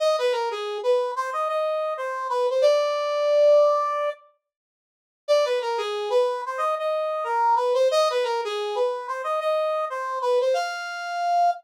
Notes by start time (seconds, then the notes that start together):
0.00 D#5
0.19 B4
0.32 A#4
0.51 G#4
0.83 B4
1.16 C5
1.33 D#5
1.49 D#5
1.97 C5
2.30 B4
2.50 C5
2.62 D5
5.28 D5
5.45 B4
5.61 A#4
5.78 G#4
6.10 B4
6.46 C5
6.58 D#5
6.79 D#5
7.24 A#4
7.56 B4
7.74 C5
7.91 D#5
8.10 B4
8.24 A#4
8.45 G#4
8.75 B4
9.08 C5
9.24 D#5
9.40 D#5
9.90 C5
10.22 B4
10.41 C5
10.54 F5